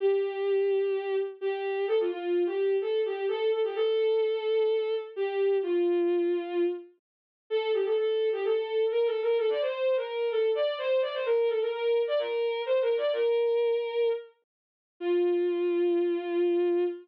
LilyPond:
\new Staff { \time 4/4 \key c \major \tempo 4 = 128 g'2. g'4 | a'16 f'16 f'8. g'8. a'8 g'8 a'8 a'16 g'16 | a'2. g'4 | f'2~ f'8 r4. |
\key f \major a'8 g'16 a'16 a'8. g'16 a'4 \tuplet 3/2 { bes'8 a'8 bes'8 } | a'16 d''16 c''8. bes'8. a'8 d''8 c''8 d''16 c''16 | bes'8 a'16 bes'16 bes'8. d''16 bes'4 \tuplet 3/2 { c''8 bes'8 d''8 } | bes'2~ bes'8 r4. |
f'1 | }